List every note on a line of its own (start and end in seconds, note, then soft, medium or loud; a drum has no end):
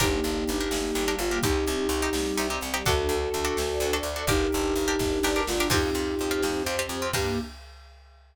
0.00 0.20 G1 loud
0.00 0.70 A#3 medium
0.00 0.38 D4 loud
0.00 0.70 D4 medium
0.00 1.15 D#4 medium
0.00 0.38 G4 loud
0.00 0.70 G4 medium
0.00 1.15 G4 loud
0.00 0.38 A#4 loud
0.00 kick loud
0.00 closed hi-hat loud
0.24 0.44 G1 medium
0.24 closed hi-hat medium
0.48 0.69 G1 medium
0.48 closed hi-hat medium
0.61 0.89 D4 loud
0.61 0.89 G4 loud
0.61 0.89 A#4 loud
0.71 0.91 G1 medium
0.71 1.42 G3 medium
0.71 1.42 A#3 medium
0.71 1.42 G4 medium
0.71 snare loud
0.95 1.16 G1 medium
0.95 1.05 D4 loud
0.95 1.05 G4 loud
0.95 1.05 A#4 loud
0.95 closed hi-hat medium
1.08 1.27 D4 loud
1.08 1.27 G4 loud
1.08 1.27 A#4 loud
1.19 1.39 G1 medium
1.19 1.39 F4 medium
1.19 closed hi-hat medium
1.31 1.41 D4 medium
1.31 1.41 G4 medium
1.31 1.41 A#4 loud
1.43 1.65 C2 medium
1.43 2.13 C4 medium
1.43 1.82 C4 loud
1.43 2.13 D#4 medium
1.43 2.48 D#4 medium
1.43 1.82 D#4 loud
1.43 2.13 G4 medium
1.43 2.48 G4 loud
1.43 1.82 G4 loud
1.43 kick loud
1.43 closed hi-hat loud
1.67 1.88 C2 medium
1.67 closed hi-hat medium
1.89 2.09 C2 medium
1.89 closed hi-hat medium
2.02 2.31 C4 loud
2.02 2.31 D#4 medium
2.02 2.31 G4 loud
2.13 2.33 C2 medium
2.13 2.85 G3 medium
2.13 2.85 C4 medium
2.13 2.85 G4 medium
2.13 snare loud
2.37 2.59 C2 medium
2.37 2.47 C4 medium
2.37 2.47 D#4 medium
2.37 2.47 G4 loud
2.37 closed hi-hat medium
2.50 2.69 C4 loud
2.50 2.69 D#4 loud
2.50 2.69 G4 loud
2.61 2.83 C2 medium
2.61 closed hi-hat medium
2.74 2.83 C4 medium
2.74 2.83 D#4 loud
2.74 2.83 G4 loud
2.86 3.08 D2 medium
2.86 3.24 D4 loud
2.86 3.56 D4 medium
2.86 3.95 F#4 loud
2.86 3.24 F#4 loud
2.86 3.57 F#4 medium
2.86 3.95 A4 loud
2.86 3.24 A4 loud
2.86 3.56 A4 medium
2.86 kick loud
2.86 closed hi-hat loud
3.09 3.29 D2 medium
3.09 closed hi-hat medium
3.34 3.54 D2 medium
3.34 closed hi-hat medium
3.45 3.73 D4 loud
3.45 3.73 F#4 loud
3.45 3.73 A4 loud
3.57 3.78 D2 medium
3.57 4.28 D4 medium
3.57 4.28 A4 medium
3.57 4.28 D5 medium
3.57 snare loud
3.80 4.00 D2 medium
3.80 3.91 D4 medium
3.80 3.91 F#4 loud
3.80 3.91 A4 medium
3.80 closed hi-hat medium
3.93 4.12 D4 loud
3.93 4.12 F#4 loud
3.93 4.12 A4 loud
4.03 4.23 D2 medium
4.03 closed hi-hat medium
4.16 4.25 D4 loud
4.16 4.25 F#4 loud
4.16 4.25 A4 medium
4.27 4.48 G1 medium
4.27 4.99 D4 medium
4.27 4.67 D4 loud
4.27 5.41 D#4 loud
4.27 4.99 G4 medium
4.27 4.67 G4 loud
4.27 5.41 G4 loud
4.27 4.99 A#4 medium
4.27 4.67 A#4 loud
4.27 kick loud
4.27 closed hi-hat loud
4.52 4.74 G1 medium
4.52 closed hi-hat medium
4.76 4.96 G1 medium
4.76 closed hi-hat medium
4.88 5.16 D4 loud
4.88 5.16 G4 loud
4.88 5.16 A#4 loud
4.99 5.20 G1 medium
4.99 5.71 D4 medium
4.99 5.71 A#4 medium
4.99 5.71 D5 medium
4.99 kick medium
4.99 snare medium
5.23 5.44 G1 medium
5.23 5.34 D4 loud
5.23 5.34 G4 loud
5.23 5.34 A#4 medium
5.23 snare medium
5.36 5.55 D4 loud
5.36 5.55 G4 medium
5.36 5.55 A#4 medium
5.47 5.69 G1 medium
5.47 5.67 F4 medium
5.47 snare loud
5.60 5.70 D4 loud
5.60 5.70 G4 loud
5.60 5.70 A#4 loud
5.70 5.90 F2 loud
5.70 6.42 C4 medium
5.70 6.09 C4 loud
5.70 6.63 D#4 medium
5.70 6.42 F4 medium
5.70 6.09 F4 loud
5.70 6.42 G4 medium
5.70 6.09 G4 loud
5.70 6.63 G4 loud
5.70 kick loud
5.70 crash loud
5.94 6.15 F2 medium
5.94 closed hi-hat medium
6.19 6.41 F2 medium
6.19 closed hi-hat medium
6.31 6.60 C4 loud
6.31 6.60 F4 loud
6.31 6.60 G4 medium
6.42 6.63 F2 medium
6.42 7.14 C4 medium
6.42 7.13 G4 medium
6.42 7.14 C5 medium
6.42 snare loud
6.66 6.87 F2 medium
6.66 6.76 C4 loud
6.66 6.76 F4 medium
6.66 6.76 G4 loud
6.66 closed hi-hat medium
6.79 6.98 C4 loud
6.79 6.98 F4 loud
6.79 6.98 G4 loud
6.89 7.09 F2 medium
6.89 closed hi-hat medium
7.02 7.12 C4 loud
7.02 7.12 F4 loud
7.02 7.12 G4 loud
7.13 7.38 G2 loud
7.13 7.38 A#3 loud
7.13 7.38 D4 loud
7.13 7.39 D4 loud
7.13 7.38 G4 loud
7.13 7.39 G4 loud
7.13 7.39 A#4 medium
7.13 kick loud
7.13 crash loud